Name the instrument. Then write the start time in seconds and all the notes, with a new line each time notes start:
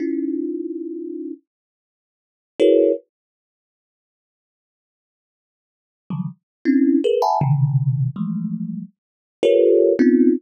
kalimba
0.00 C#4 D#4 E4 F4
2.60 E4 F#4 G#4 A#4 B4 C#5
6.10 C#3 D3 D#3 F3 F#3 G3
6.65 C4 C#4 D4 E4
7.04 G#4 A#4 B4
7.22 E5 F#5 G#5 A5 B5
7.41 B2 C3 C#3 D3 D#3
8.16 E3 F3 G3 G#3 A3
9.43 F4 G4 A4 A#4 B4 C#5
9.99 B3 C4 C#4 D#4 F4